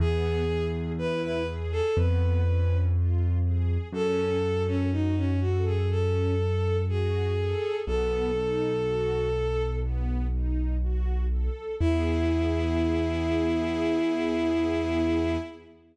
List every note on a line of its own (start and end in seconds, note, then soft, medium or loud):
0.00 1.81 E2 loud
0.00 0.44 B3 loud
0.00 0.64 G#4 medium
0.48 0.92 G#4 medium
0.98 1.43 E4 medium
0.98 1.22 B4 medium
1.23 1.46 B4 medium
1.48 1.92 G#4 medium
1.72 1.96 A4 medium
1.97 3.78 F2 loud
1.97 2.42 B3 medium
1.97 2.77 B4 medium
2.46 2.90 C#4 medium
2.95 3.39 F4 medium
3.44 3.89 G#4 medium
3.93 7.55 F#2 loud
3.93 4.38 C#4 loud
3.93 4.62 A4 medium
4.43 4.87 A4 medium
4.67 4.91 C#4 medium
4.92 5.15 D#4 medium
4.92 5.36 F#4 medium
5.16 5.40 C#4 medium
5.41 5.64 F#4 medium
5.41 5.85 A4 medium
5.66 5.89 G#4 medium
5.90 6.34 C#4 medium
5.90 6.77 A4 medium
6.40 6.84 A4 medium
6.89 7.33 F#4 medium
6.89 7.75 G#4 medium
7.37 7.81 A4 medium
7.87 11.49 B1 loud
7.87 8.31 B3 loud
7.87 9.63 A4 medium
8.36 8.80 D#4 medium
8.85 9.29 F#4 medium
9.35 9.79 A4 medium
9.83 10.27 B3 loud
10.33 10.77 D#4 medium
10.82 11.26 F#4 medium
11.31 11.76 A4 medium
11.80 15.37 E2 medium
11.80 15.36 B3 loud
11.80 15.36 E4 medium
11.80 15.37 E4 loud
11.80 15.36 G#4 loud